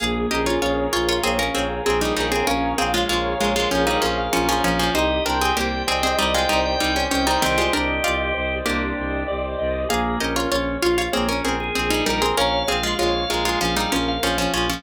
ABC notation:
X:1
M:4/4
L:1/16
Q:1/4=97
K:Bbdor
V:1 name="Pizzicato Strings"
[Af]2 [Ge] [Fd] [Fd]2 [Fd] [Fd] [CA] [DB] [CA]2 [CA] [G,E] [G,E] [CA] | [DB]2 [CA] [A,F] [A,F]2 [A,F] [A,F] [F,D] [G,E] [F,D]2 [F,D] [F,D] [F,D] [F,D] | [Ec]2 [=DB] [CA] [B,G]2 [CA] [CA] [G,E] [A,F] [G,E]2 [G,E] _D D [G,E] | [E,C] [A,F] [=DB]2 [F=d]2 z2 [B,G]4 z4 |
[Af]2 [Ge] [Fd] [Fd]2 [Fd] [Fd] [CA] [DB] [CA]2 [CA] [G,E] [G,E] [CA] | [DB]2 [CA] [A,F] [A,F]2 [A,F] [A,F] [F,D] [G,E] [F,D]2 [F,D] [F,D] [F,D] [F,D] |]
V:2 name="Drawbar Organ"
B,2 D2 D2 F2 B, D2 A3 B2 | f2 f2 f2 f2 f f2 f3 f2 | e2 g2 g2 g2 e g2 g3 g2 | G8 =D4 z4 |
B,2 D2 D2 F2 B, D2 A3 B2 | f2 f2 f2 f2 f f2 f3 f2 |]
V:3 name="Acoustic Grand Piano"
A2 B2 d2 f2 d2 B2 A2 B2 | d2 f2 d2 B2 A2 B2 d2 f2 | G2 c2 =d2 e2 d2 c2 G2 c2 | =d2 e2 d2 c2 G2 c2 d2 e2 |
A2 B2 d2 f2 d2 B2 A2 B2 | d2 f2 d2 B2 A2 B2 d2 f2 |]
V:4 name="Violin" clef=bass
B,,,2 B,,,2 B,,,2 B,,,2 B,,,2 B,,,2 B,,,2 B,,,2 | B,,,2 B,,,2 B,,,2 B,,,2 B,,,2 B,,,2 B,,,2 B,,,2 | C,,2 C,,2 C,,2 C,,2 C,,2 C,,2 C,,2 C,,2 | C,,2 C,,2 C,,2 C,,2 C,,2 C,,2 C,,2 C,,2 |
B,,,2 B,,,2 B,,,2 B,,,2 B,,,2 B,,,2 B,,,2 B,,,2 | B,,,2 B,,,2 B,,,2 B,,,2 B,,,2 B,,,2 B,,,2 B,,,2 |]